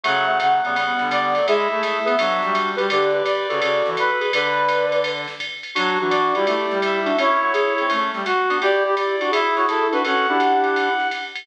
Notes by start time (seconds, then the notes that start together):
0.03 C#3 F#3 A3 F#5, ride
0.28 F#3 A3
0.40 C#3 F#5, hi-hat pedal, ride
0.64 C#3 G3 B3, ride
0.76 G3 B3, ride
0.99 D3, snare
1.11 D5, hi-hat pedal, ride
1.35 F#3 A3, ride
1.47 G#3 E4 G#4 E5, ride
1.71 A3 E4 G#4
1.83 E5, hi-hat pedal, ride
2.05 B3 G#4 B4, ride
2.18 F#3 D4 F#4, ride
2.42 G3, snare
2.55 hi-hat pedal, ride
2.76 G3 G4 B4, ride
2.89 D3 G4 B4 D5, ride
3.14 G4 B4
3.25 D5, kick, hi-hat pedal, ride
3.49 C#3 F#4 A4, ride
3.60 C#3 F#4 A4, ride
3.86 E3, snare
3.97 B4, hi-hat pedal, ride
4.20 G#4 B4, ride
4.32 D3 B4 D5, ride
4.69 hi-hat pedal, ride
4.92 ride
5.04 ride
5.28 snare
5.40 kick, hi-hat pedal, ride
5.63 ride
5.75 F#3 D4 F#4, ride
6.00 E3 D4 F#4
6.10 D5, hi-hat pedal, ride
6.35 G3 E4 G4, ride
6.46 A3 E4 G4, ride
6.71 G3, snare
6.82 E5, hi-hat pedal, ride
7.05 D4 F#4, ride
7.17 A3 C#4 E4 C#5, ride
7.42 F#3 A3
7.53 E4 G#4, hi-hat pedal, ride
7.78 C4, ride
7.89 A3 C#4, kick, ride
8.13 G3, snare
8.25 F#4, hi-hat pedal, ride
8.49 B3 D4, ride
8.61 E4 G4 D5, ride
8.85 E4 G4
8.96 D5, hi-hat pedal, ride
9.20 D4 F#4, ride
9.31 E4 G#4 E5, ride
9.56 F#4 C#5, snare
9.68 E4 A4, hi-hat pedal, ride
9.92 D4 F#4 B4, ride
10.04 C#4 F#4 A4 F#5, ride
10.28 D4 E4 G4
10.40 hi-hat pedal, ride
10.64 ride
10.76 ride
10.99 snare
11.11 hi-hat pedal, ride
11.35 ride